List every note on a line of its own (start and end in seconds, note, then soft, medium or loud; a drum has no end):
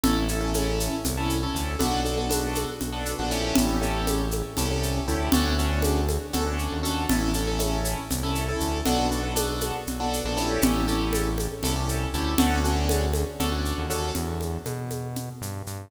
0.03 0.89 A1 loud
0.03 0.24 C#4 loud
0.03 0.24 E4 loud
0.03 0.24 A4 loud
0.03 low conga loud
0.03 shaker medium
0.28 0.39 C#4 loud
0.28 0.39 E4 loud
0.28 0.39 A4 loud
0.28 shaker medium
0.41 0.51 C#4 loud
0.41 0.51 E4 loud
0.41 0.51 A4 loud
0.54 0.95 C#4 loud
0.54 0.95 E4 loud
0.54 0.95 A4 loud
0.54 high conga medium
0.54 shaker medium
0.80 shaker medium
1.05 1.47 C2 loud
1.05 low conga medium
1.05 shaker medium
1.17 1.37 C#4 loud
1.17 1.37 E4 loud
1.17 1.37 A4 loud
1.30 shaker medium
1.43 1.73 C#4 loud
1.43 1.73 E4 loud
1.43 1.73 A4 loud
1.55 1.76 D2 loud
1.55 shaker medium
1.79 2.66 B1 loud
1.79 1.99 B3 loud
1.79 1.99 D4 loud
1.79 1.99 F#4 loud
1.79 1.99 A4 loud
1.79 low conga loud
1.79 shaker medium
2.05 2.15 B3 medium
2.05 2.15 D4 loud
2.05 2.15 F#4 loud
2.05 2.15 A4 loud
2.05 shaker medium
2.17 2.27 B3 loud
2.17 2.27 D4 medium
2.17 2.27 F#4 medium
2.17 2.27 A4 loud
2.30 2.70 B3 loud
2.30 2.70 D4 loud
2.30 2.70 F#4 loud
2.30 2.70 A4 loud
2.30 high conga medium
2.30 shaker loud
2.55 high conga medium
2.55 shaker medium
2.81 3.15 B1 medium
2.81 low conga medium
2.81 shaker medium
2.92 3.13 B3 loud
2.92 3.13 D4 loud
2.92 3.13 F#4 loud
2.92 3.13 A4 loud
3.06 shaker medium
3.19 3.53 A#1 loud
3.19 3.31 B3 loud
3.19 3.31 D4 loud
3.19 3.31 F#4 loud
3.19 3.31 A4 loud
3.31 3.76 C#4 loud
3.31 3.76 E4 loud
3.31 3.76 G4 loud
3.31 3.76 A4 loud
3.31 shaker medium
3.55 4.43 A1 loud
3.55 low conga loud
3.55 shaker medium
3.81 4.21 C#4 loud
3.81 4.21 E4 loud
3.81 4.21 G4 loud
3.81 4.21 A4 loud
3.81 shaker medium
4.07 high conga medium
4.07 shaker medium
4.31 high conga medium
4.31 shaker medium
4.57 5.00 C2 loud
4.57 4.67 C#4 loud
4.57 4.67 E4 loud
4.57 4.67 G4 loud
4.57 4.67 A4 loud
4.57 low conga medium
4.57 shaker medium
4.70 5.01 C#4 loud
4.70 5.01 E4 medium
4.70 5.01 G4 loud
4.70 5.01 A4 loud
4.83 shaker medium
5.08 5.29 D2 loud
5.08 5.28 C#4 loud
5.08 5.28 E4 loud
5.08 5.28 G4 loud
5.08 5.28 A4 loud
5.08 shaker medium
5.32 6.18 D2 loud
5.32 5.53 C#4 loud
5.32 5.53 D4 loud
5.32 5.53 F#4 loud
5.32 5.53 A4 loud
5.32 low conga loud
5.32 shaker medium
5.59 5.99 C#4 loud
5.59 5.99 D4 loud
5.59 5.99 F#4 loud
5.59 5.99 A4 medium
5.59 shaker medium
5.82 high conga loud
5.82 shaker medium
6.09 high conga medium
6.09 shaker medium
6.33 6.68 D2 loud
6.33 6.43 C#4 loud
6.33 6.43 D4 loud
6.33 6.43 F#4 loud
6.33 6.43 A4 loud
6.33 low conga medium
6.33 shaker medium
6.46 6.77 C#4 loud
6.46 6.77 D4 loud
6.46 6.77 F#4 loud
6.46 6.77 A4 medium
6.59 shaker medium
6.72 7.06 D#2 loud
6.83 7.03 C#4 loud
6.83 7.03 D4 medium
6.83 7.03 F#4 loud
6.83 7.03 A4 loud
6.83 shaker medium
7.09 7.95 A1 loud
7.09 7.30 C#4 loud
7.09 7.30 E4 loud
7.09 7.30 A4 loud
7.09 low conga loud
7.09 shaker medium
7.34 7.45 C#4 loud
7.34 7.45 E4 loud
7.34 7.45 A4 loud
7.34 shaker medium
7.47 7.57 C#4 loud
7.47 7.57 E4 loud
7.47 7.57 A4 loud
7.59 7.99 C#4 loud
7.59 7.99 E4 loud
7.59 7.99 A4 loud
7.59 high conga medium
7.59 shaker medium
7.85 shaker medium
8.11 8.53 C2 loud
8.11 low conga medium
8.11 shaker medium
8.23 8.43 C#4 loud
8.23 8.43 E4 loud
8.23 8.43 A4 loud
8.35 shaker medium
8.48 8.79 C#4 loud
8.48 8.79 E4 loud
8.48 8.79 A4 loud
8.60 8.82 D2 loud
8.60 shaker medium
8.85 9.72 B1 loud
8.85 9.06 B3 loud
8.85 9.06 D4 loud
8.85 9.06 F#4 loud
8.85 9.06 A4 loud
8.85 low conga loud
8.85 shaker medium
9.11 9.21 B3 medium
9.11 9.21 D4 loud
9.11 9.21 F#4 loud
9.11 9.21 A4 loud
9.11 shaker medium
9.23 9.33 B3 loud
9.23 9.33 D4 medium
9.23 9.33 F#4 medium
9.23 9.33 A4 loud
9.36 9.76 B3 loud
9.36 9.76 D4 loud
9.36 9.76 F#4 loud
9.36 9.76 A4 loud
9.36 high conga medium
9.36 shaker loud
9.61 high conga medium
9.61 shaker medium
9.87 10.21 B1 medium
9.87 low conga medium
9.87 shaker medium
10.00 10.20 B3 loud
10.00 10.20 D4 loud
10.00 10.20 F#4 loud
10.00 10.20 A4 loud
10.13 shaker medium
10.24 10.58 A#1 loud
10.24 10.37 B3 loud
10.24 10.37 D4 loud
10.24 10.37 F#4 loud
10.24 10.36 A4 loud
10.37 10.82 C#4 loud
10.37 10.82 E4 loud
10.37 10.82 G4 loud
10.37 10.82 A4 loud
10.37 shaker medium
10.62 11.48 A1 loud
10.62 low conga loud
10.62 shaker medium
10.88 11.28 C#4 loud
10.88 11.28 E4 loud
10.88 11.28 G4 loud
10.88 11.28 A4 loud
10.88 shaker medium
11.13 high conga medium
11.13 shaker medium
11.38 high conga medium
11.38 shaker medium
11.63 12.06 C2 loud
11.63 11.73 C#4 loud
11.63 11.73 E4 loud
11.63 11.73 G4 loud
11.63 11.73 A4 loud
11.63 low conga medium
11.63 shaker medium
11.76 12.06 C#4 loud
11.76 12.06 E4 medium
11.76 12.06 G4 loud
11.76 12.06 A4 loud
11.89 shaker medium
12.14 12.35 D2 loud
12.14 12.34 C#4 loud
12.14 12.34 E4 loud
12.14 12.34 G4 loud
12.14 12.34 A4 loud
12.14 shaker medium
12.38 13.24 D2 loud
12.38 12.59 C#4 loud
12.38 12.59 D4 loud
12.38 12.59 F#4 loud
12.38 12.59 A4 loud
12.38 low conga loud
12.38 shaker medium
12.64 13.04 C#4 loud
12.64 13.04 D4 loud
12.64 13.04 F#4 loud
12.64 13.04 A4 medium
12.64 shaker medium
12.89 high conga loud
12.89 shaker medium
13.13 high conga medium
13.13 shaker medium
13.39 13.73 D2 loud
13.39 13.50 C#4 loud
13.39 13.50 D4 loud
13.39 13.50 F#4 loud
13.39 13.50 A4 loud
13.39 low conga medium
13.39 shaker medium
13.52 13.82 C#4 loud
13.52 13.82 D4 loud
13.52 13.82 F#4 loud
13.52 13.82 A4 medium
13.65 shaker medium
13.78 14.12 D#2 loud
13.90 14.10 C#4 loud
13.90 14.10 D4 medium
13.90 14.10 F#4 loud
13.90 14.10 A4 loud
13.90 shaker medium
14.15 14.58 E2 loud
14.15 low conga medium
14.15 shaker medium
14.41 high conga medium
14.41 shaker medium
14.65 15.30 B2 loud
14.65 high conga medium
14.65 shaker medium
14.90 high conga medium
14.90 shaker medium
15.16 low conga medium
15.16 shaker medium
15.41 15.63 G2 loud
15.41 shaker medium
15.67 15.88 G2 medium
15.67 shaker medium